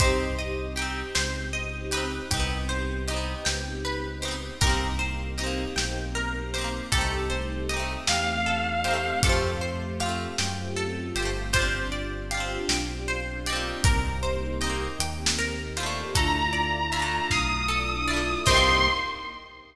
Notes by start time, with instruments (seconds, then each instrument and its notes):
0.00 synth bass 2 C2, string ensemble 1 C4 D#4 G4, acoustic guitar (steel) D#4 G4, pizzicato strings C5, kick, closed hi-hat
0.04 acoustic guitar (steel) C4
0.39 pizzicato strings D#5
0.76 acoustic guitar (steel) D#4 G4, pizzicato strings G5, closed hi-hat
0.82 acoustic guitar (steel) C4
1.15 synth bass 2 C#2, pizzicato strings C5, snare
1.53 pizzicato strings D#5
1.91 acoustic guitar (steel) D#4 G4, pizzicato strings B4, closed hi-hat
1.97 acoustic guitar (steel) C4
2.31 synth bass 2 C2, string ensemble 1 B3 C4 D#4 G4, acoustic guitar (steel) D#4 G4, kick, closed hi-hat
2.37 acoustic guitar (steel) B3 C4
2.69 pizzicato strings C5
3.08 acoustic guitar (steel) D#4 G4, pizzicato strings D#5, closed hi-hat
3.13 acoustic guitar (steel) B3 C4
3.45 synth bass 2 C#2, pizzicato strings G5, snare
3.85 pizzicato strings B4
4.22 acoustic guitar (steel) D#4 G4, pizzicato strings C5, closed hi-hat
4.28 acoustic guitar (steel) B3 C4
4.61 synth bass 2 C2, string ensemble 1 A#3 C4 D#4 G4, acoustic guitar (steel) D#4 G4, pizzicato strings A#4, kick, closed hi-hat
4.67 acoustic guitar (steel) A#3 C4
4.99 pizzicato strings C5
5.38 acoustic guitar (steel) D#4 G4, pizzicato strings D#5, closed hi-hat
5.43 acoustic guitar (steel) A#3 C4
5.76 synth bass 2 B1, pizzicato strings G5, snare
6.15 pizzicato strings A#4
6.54 acoustic guitar (steel) G4, pizzicato strings C5, closed hi-hat
6.58 acoustic guitar (steel) C4 D#4
6.64 acoustic guitar (steel) A#3
6.92 synth bass 2 C2, string ensemble 1 A3 C4 D#4 G4, acoustic guitar (steel) D#4 G4, pizzicato strings A4, kick, closed hi-hat
6.98 acoustic guitar (steel) A3 C4
7.30 pizzicato strings C5
7.69 acoustic guitar (steel) G4, pizzicato strings D#5, closed hi-hat
7.74 acoustic guitar (steel) C4 D#4
7.79 acoustic guitar (steel) A3
8.07 synth bass 2 E2, lead 1 (square) F5, pizzicato strings G5, snare
8.46 pizzicato strings A4
8.84 acoustic guitar (steel) D#4 G4, pizzicato strings C5, closed hi-hat
8.91 acoustic guitar (steel) A3 C4
9.23 synth bass 2 F2, string ensemble 1 A3 C4 F4 G4, acoustic guitar (steel) F4 G4, pizzicato strings A4, kick, closed hi-hat
9.29 acoustic guitar (steel) A3 C4
9.61 pizzicato strings C5
10.00 acoustic guitar (steel) F4 G4, pizzicato strings F5, closed hi-hat
10.06 acoustic guitar (steel) A3 C4
10.38 synth bass 2 F#2, pizzicato strings G5, snare
10.76 pizzicato strings A4
11.15 synth bass 2 G1, acoustic guitar (steel) G4, pizzicato strings C5, closed hi-hat
11.19 acoustic guitar (steel) C4 F4
11.25 acoustic guitar (steel) A3
11.53 string ensemble 1 C4 D4 F4 G4, acoustic guitar (steel) F4 G4, pizzicato strings C5, kick, closed hi-hat
11.59 acoustic guitar (steel) C4 D4
11.92 pizzicato strings D5
12.31 acoustic guitar (steel) F4 G4, pizzicato strings F5, closed hi-hat
12.37 acoustic guitar (steel) C4 D4
12.68 synth bass 2 B1, pizzicato strings G5, snare
13.08 pizzicato strings C5
13.46 acoustic guitar (steel) D#4 G4, pizzicato strings D5, closed hi-hat
13.53 acoustic guitar (steel) A#3 C4
13.84 synth bass 2 C2, string ensemble 1 A#3 C4 D#4 G4, pizzicato strings A#4, kick, closed hi-hat
14.23 pizzicato strings C5
14.61 acoustic guitar (steel) D#4 G4, pizzicato strings D#5, closed hi-hat
14.67 acoustic guitar (steel) A#3 C4
14.99 synth bass 2 D#2, pizzicato strings G5, closed hi-hat
15.26 snare
15.39 pizzicato strings A#4
15.77 acoustic guitar (steel) E4 F4, pizzicato strings C5, closed hi-hat
15.83 acoustic guitar (steel) A3 D4
16.15 synth bass 2 D2, string ensemble 1 A3 D4 E4 F4, pizzicato strings A4, lead 1 (square) A#5, kick, closed hi-hat
16.53 pizzicato strings D5
16.92 acoustic guitar (steel) F4, pizzicato strings E5, closed hi-hat
16.96 acoustic guitar (steel) D4 E4
17.02 acoustic guitar (steel) A3
17.30 synth bass 2 B1, pizzicato strings F5, lead 1 (square) D#6, kick, snare
17.68 pizzicato strings A4
18.08 acoustic guitar (steel) E4 F4, pizzicato strings D5
18.13 acoustic guitar (steel) A3 D4
18.46 synth bass 2 C2, string ensemble 1 A#3 C4 D#4 G4, acoustic guitar (steel) G4, pizzicato strings A#4 C5 D#5 G5, lead 1 (square) C6, kick, crash
18.51 acoustic guitar (steel) C4 D#4
18.57 acoustic guitar (steel) A#3